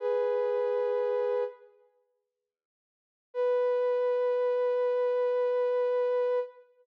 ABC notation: X:1
M:4/4
L:1/8
Q:1/4=72
K:Bmix
V:1 name="Ocarina"
[GB]4 z4 | B8 |]